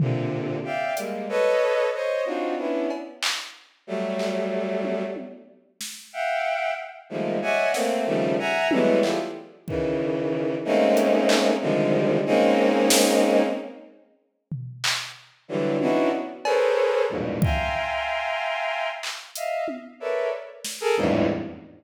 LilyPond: <<
  \new Staff \with { instrumentName = "Violin" } { \time 6/8 \tempo 4. = 62 <bes, c d>4 <d'' e'' f'' g''>8 <g aes bes>8 <a' b' des'' ees''>4 | <c'' des'' ees''>8 <c' d' ees' f' ges'>8 <b des' d' e'>8 r4. | <ges g a>2 r4 | r8 <e'' f'' ges'' g''>4 r8 <ees f g aes a bes>8 <des'' d'' ees'' e'' ges'' aes''>8 |
<a bes c'>8 <des ees f g a>8 <e'' ges'' aes'' bes''>8 <e ges g aes a b>8 <e' f' g' aes' a'>16 r8. | <des ees e>4. <aes a bes c' des' ees'>4. | <c d ees f g aes>4 <aes bes c' des' ees'>2 | r2. |
<d e ges g>8 <b des' d' ees' e' ges'>8 r8 <aes' a' bes' b' c'' des''>4 <e, f, g, aes, bes, b,>8 | <e'' f'' g'' aes'' bes'' c'''>2~ <e'' f'' g'' aes'' bes'' c'''>8 r8 | <ees'' e'' f''>8 r8 <a' bes' b' des'' d'' e''>8 r8. <aes' a' bes'>16 <e, f, g, aes, a,>8 | }
  \new DrumStaff \with { instrumentName = "Drums" } \drummode { \time 6/8 tomfh4. hh4. | r4. cb8 hc4 | r8 hc4 tommh8 tommh4 | sn4. r4. |
sn4. tommh8 hc4 | bd4. r8 hh8 hc8 | r4. r8 sn4 | r4. tomfh8 hc4 |
r8 tommh8 tommh8 cb4. | bd4. r4 hc8 | hh8 tommh4 r8 sn4 | }
>>